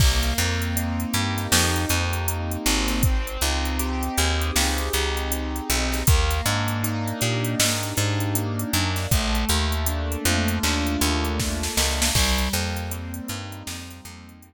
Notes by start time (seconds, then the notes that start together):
0.00 C2 A#3, kick, crash
0.23 closed hi-hat
0.38 F2 C4, closed hi-hat
0.62 closed hi-hat
0.76 D#4, closed hi-hat
1.00 closed hi-hat
1.14 G2 G4, closed hi-hat
1.38 snare, closed hi-hat
1.52 F2 D#4, snare
1.76 closed hi-hat
1.89 F2 C4, closed hi-hat
2.13 closed hi-hat
2.28 A#3, closed hi-hat
2.51 closed hi-hat
2.66 G#1 C4, closed hi-hat
2.88 snare, closed hi-hat
3.03 C4, kick, closed hi-hat
3.27 closed hi-hat
3.41 C#2 D#4, closed hi-hat
3.65 closed hi-hat
3.79 G4, closed hi-hat
4.03 closed hi-hat
4.17 D#2 G#4, closed hi-hat
4.41 closed hi-hat
4.56 C#2 G4, snare
4.78 closed hi-hat
4.93 C#2 D#4, closed hi-hat
5.17 closed hi-hat
5.32 C4, closed hi-hat
5.56 closed hi-hat
5.69 B1 D#4, closed hi-hat
5.92 snare, closed hi-hat
6.07 D#2 A#3, kick, closed hi-hat
6.30 snare, closed hi-hat
6.46 G#2 D4, closed hi-hat
6.68 closed hi-hat
6.84 D#4, closed hi-hat
7.08 closed hi-hat
7.21 A#2 G4, closed hi-hat
7.44 closed hi-hat
7.59 G#2 D#4, snare
7.83 closed hi-hat
7.97 G#2 D4, closed hi-hat
8.20 closed hi-hat
8.35 A#3, closed hi-hat
8.59 closed hi-hat
8.73 F#2 D4, closed hi-hat
8.96 snare, closed hi-hat
9.11 A#1 A3, kick, closed hi-hat
9.35 closed hi-hat
9.49 D#2 A#3, closed hi-hat
9.72 closed hi-hat
9.86 D4, closed hi-hat
10.12 closed hi-hat
10.25 F2 F4, closed hi-hat
10.48 closed hi-hat
10.63 D#2 D4, clap
10.87 closed hi-hat
11.01 D#2 A#3, closed hi-hat
11.25 closed hi-hat
11.40 A3, kick, snare
11.63 snare
11.77 C#2 A#3, snare
12.02 snare
12.15 C2 G3, kick, crash
12.38 closed hi-hat
12.53 F2 A#3, closed hi-hat
12.77 closed hi-hat
12.91 C4, closed hi-hat
13.14 closed hi-hat
13.28 G2 D#4, closed hi-hat
13.52 closed hi-hat
13.67 F2 C4, snare
13.91 closed hi-hat
14.05 F2 A#3, closed hi-hat
14.29 closed hi-hat
14.42 G3, closed hi-hat